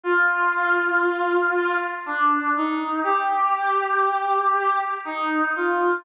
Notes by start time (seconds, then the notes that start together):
0.04 F4
2.06 D4
2.57 D#4
3.03 G4
5.05 D#4
5.56 F4